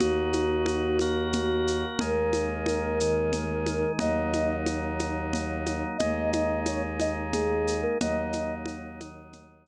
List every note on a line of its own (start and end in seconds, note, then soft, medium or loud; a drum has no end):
0.00 1.84 D#2 medium
0.00 0.98 A#3 medium
0.00 0.98 D#4 medium
0.00 0.98 F#4 medium
0.00 1.86 F#4 medium
0.00 low conga loud
0.00 shaker medium
0.33 high conga medium
0.33 shaker medium
0.66 high conga loud
0.66 shaker medium
0.99 2.00 A#3 medium
0.99 2.00 F#4 medium
0.99 2.00 A#4 medium
0.99 high conga medium
0.99 shaker medium
1.33 low conga loud
1.33 shaker medium
1.67 shaker medium
1.99 3.84 D#2 medium
1.99 2.99 G#3 medium
1.99 2.99 A#3 medium
1.99 2.99 D#4 medium
1.99 3.92 A#4 medium
1.99 low conga loud
1.99 shaker medium
2.33 high conga medium
2.33 shaker medium
2.66 high conga medium
2.66 shaker medium
3.00 4.00 D#3 medium
3.00 4.00 G#3 medium
3.00 3.99 D#4 medium
3.00 shaker medium
3.33 low conga medium
3.33 shaker medium
3.66 high conga medium
3.66 shaker medium
3.99 5.84 D#2 medium
3.99 5.98 F#3 medium
3.99 5.98 A#3 medium
3.99 5.98 D#4 medium
3.99 4.56 D#5 medium
3.99 low conga loud
3.99 shaker medium
4.33 high conga medium
4.33 shaker medium
4.66 high conga medium
4.66 shaker medium
4.99 high conga medium
4.99 shaker medium
5.33 low conga medium
5.33 shaker medium
5.66 high conga medium
5.66 shaker medium
5.98 7.84 D#2 medium
5.98 7.98 G#3 medium
5.98 7.98 A#3 medium
5.98 7.98 D#4 medium
5.98 6.30 D#5 medium
5.98 low conga loud
5.98 shaker medium
6.31 6.60 D#5 medium
6.31 high conga loud
6.31 shaker medium
6.66 6.83 C#5 medium
6.66 high conga medium
6.66 shaker medium
7.00 7.16 D#5 medium
7.00 high conga medium
7.00 shaker medium
7.32 7.81 G#4 medium
7.32 low conga medium
7.32 shaker medium
7.67 shaker medium
7.82 7.98 A#4 medium
8.00 9.67 D#2 medium
8.00 9.00 F#3 medium
8.00 9.00 A#3 loud
8.00 9.00 D#4 medium
8.00 8.55 D#5 medium
8.00 low conga loud
8.00 shaker medium
8.33 high conga medium
8.33 shaker medium
8.66 high conga loud
8.66 shaker medium
9.00 9.67 D#3 medium
9.00 9.67 F#3 medium
9.00 9.67 D#4 medium
9.00 high conga medium
9.00 shaker medium
9.33 low conga medium
9.33 shaker medium
9.66 shaker medium